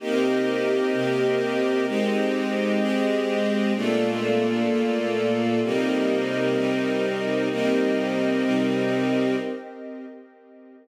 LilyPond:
<<
  \new Staff \with { instrumentName = "String Ensemble 1" } { \time 4/4 \key c \minor \tempo 4 = 128 <c bes ees' g'>2 <c bes c' g'>2 | <aes c' ees' g'>2 <aes c' g' aes'>2 | <bes, a d' f'>2 <bes, a bes f'>2 | <c g bes ees'>2 <c g c' ees'>2 |
<c g bes ees'>2 <c g c' ees'>2 | }
  \new Staff \with { instrumentName = "String Ensemble 1" } { \time 4/4 \key c \minor <c' g' bes' ees''>1 | <aes c' g' ees''>1 | <bes f' a' d''>1 | <c' g' bes' ees''>1 |
<c' g' bes' ees''>1 | }
>>